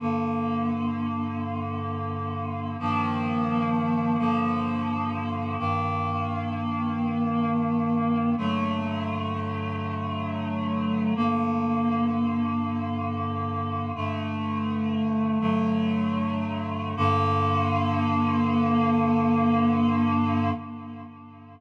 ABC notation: X:1
M:4/4
L:1/8
Q:1/4=86
K:Gm
V:1 name="Clarinet"
[G,,D,B,]8 | [G,,E,F,B,]4 [G,,D,F,B,]4 | [G,,E,B,]8 | [G,,D,^F,A,]8 |
[G,,D,B,]8 | "^rit." [G,,D,A,]4 [G,,D,^F,A,]4 | [G,,D,B,]8 |]